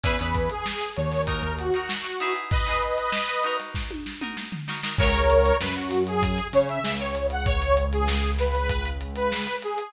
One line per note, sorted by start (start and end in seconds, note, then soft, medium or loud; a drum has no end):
0.03 0.18 E2 medium
0.03 0.16 C#4 medium
0.03 0.16 E4 loud
0.03 0.16 G#4 medium
0.03 0.19 B4 medium
0.03 0.16 B4 medium
0.03 kick loud
0.03 closed hi-hat loud
0.19 0.49 E2 medium
0.19 0.68 C#4 medium
0.19 0.68 E4 medium
0.19 0.68 G#4 medium
0.19 0.49 B4 medium
0.19 0.68 B4 medium
0.19 closed hi-hat medium
0.34 kick medium
0.34 snare soft
0.34 closed hi-hat medium
0.49 0.90 G#4 medium
0.49 closed hi-hat medium
0.66 snare loud
0.81 closed hi-hat medium
0.96 1.42 D#2 medium
0.96 1.22 C#5 medium
0.96 closed hi-hat medium
1.12 snare medium
1.12 closed hi-hat medium
1.27 1.65 D#4 loud
1.27 1.65 F#4 medium
1.27 1.56 A#4 medium
1.27 1.65 A#4 medium
1.27 kick medium
1.27 closed hi-hat loud
1.43 1.70 D#2 medium
1.43 closed hi-hat medium
1.59 2.34 F#4 medium
1.59 closed hi-hat medium
1.74 2.11 D#4 medium
1.74 2.11 F#4 medium
1.74 2.11 A#4 medium
1.74 closed hi-hat medium
1.89 snare loud
2.04 closed hi-hat medium
2.20 2.64 D#4 medium
2.20 2.64 E4 loud
2.20 2.64 G#4 medium
2.20 2.64 B4 medium
2.20 closed hi-hat medium
2.36 closed hi-hat medium
2.51 3.56 B4 medium
2.51 3.56 D#5 medium
2.51 kick loud
2.51 closed hi-hat loud
2.66 3.16 D#4 medium
2.66 3.16 E4 medium
2.66 3.16 G#4 medium
2.66 3.16 B4 medium
2.66 snare soft
2.66 closed hi-hat medium
2.82 closed hi-hat medium
2.98 closed hi-hat medium
3.12 snare loud
3.28 closed hi-hat medium
3.43 4.12 D#4 loud
3.43 4.12 F#4 medium
3.43 4.12 A#4 medium
3.43 closed hi-hat medium
3.60 snare medium
3.60 closed hi-hat medium
3.74 kick medium
3.74 snare loud
3.91 high tom medium
4.06 snare medium
4.21 4.58 D#4 medium
4.21 4.58 F#4 medium
4.21 4.58 A#4 medium
4.21 mid tom medium
4.37 snare loud
4.52 floor tom medium
4.68 4.80 D#4 medium
4.68 4.80 F#4 medium
4.68 4.80 A#4 medium
4.68 snare loud
4.83 4.96 D#4 medium
4.83 4.96 F#4 medium
4.83 4.96 A#4 medium
4.83 snare loud
4.98 5.52 C#2 medium
4.98 5.09 E4 medium
4.98 5.09 G#4 medium
4.98 5.57 A#4 medium
4.98 5.09 B4 medium
4.98 5.57 C#5 medium
4.98 5.09 C#5 medium
4.98 kick loud
4.98 crash loud
5.13 snare soft
5.13 closed hi-hat medium
5.30 closed hi-hat loud
5.46 closed hi-hat medium
5.60 6.40 F#2 medium
5.60 6.39 F#3 medium
5.60 5.75 B4 medium
5.60 snare loud
5.76 6.03 F#4 medium
5.76 closed hi-hat medium
5.91 snare medium
5.91 closed hi-hat medium
6.07 6.47 G#4 medium
6.07 closed hi-hat medium
6.22 kick loud
6.22 closed hi-hat loud
6.38 closed hi-hat medium
6.53 6.79 C#3 medium
6.53 6.80 C#4 medium
6.53 6.68 C#5 medium
6.53 closed hi-hat loud
6.69 6.83 E5 medium
6.69 closed hi-hat medium
6.84 9.47 C#2 medium
6.84 9.47 C#4 medium
6.84 6.99 E5 medium
6.84 snare loud
6.99 7.27 C#5 medium
6.99 closed hi-hat medium
7.15 closed hi-hat medium
7.30 7.46 F#5 medium
7.30 closed hi-hat medium
7.46 7.85 C#5 medium
7.46 kick loud
7.46 closed hi-hat loud
7.62 closed hi-hat medium
7.77 closed hi-hat medium
7.92 8.31 G#4 medium
7.92 closed hi-hat medium
8.08 snare loud
8.23 closed hi-hat medium
8.39 8.90 B4 medium
8.39 snare medium
8.39 closed hi-hat medium
8.55 closed hi-hat medium
8.69 kick loud
8.69 closed hi-hat loud
8.85 closed hi-hat medium
9.01 closed hi-hat medium
9.16 9.56 B4 medium
9.16 closed hi-hat medium
9.32 snare loud
9.47 closed hi-hat medium
9.62 9.92 G#4 medium
9.62 closed hi-hat medium
9.78 closed hi-hat medium